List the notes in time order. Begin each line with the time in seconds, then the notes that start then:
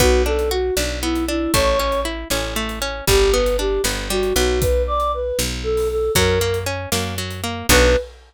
0.00 B1 B3 F#4, kick, closed hi-hat
0.26 D4 A4
0.39 closed hi-hat
0.51 F#4
0.77 B1 D4, snare
1.02 B3 E4
1.15 closed hi-hat
1.28 D4 E4
1.53 A1 A3 C#5, kick, closed hi-hat
1.79 C#4
1.92 closed hi-hat
2.05 E4
2.30 A1 C#4, snare
2.56 A3
2.69 closed hi-hat
2.82 C#4
3.07 G1 G3 G4, kick, closed hi-hat
3.33 B3 B4
3.46 closed hi-hat
3.59 D4 G4
3.84 G1 B3, snare
4.10 G3 F#4
4.23 closed hi-hat
4.36 B1 B3 F#4
4.61 B4, kick, closed hi-hat
4.87 D5
5.00 closed hi-hat
5.14 B4
5.39 B1, snare
5.63 A4
5.77 open hi-hat
5.91 A4
6.15 F#2 F#3 A#4, kick, closed hi-hat
6.41 A#3
6.54 closed hi-hat
6.66 C#4
6.92 F#2 A#3, snare
7.18 F#3
7.31 closed hi-hat
7.44 A#3
7.69 B1 B3 D4 F#4 B4, kick, crash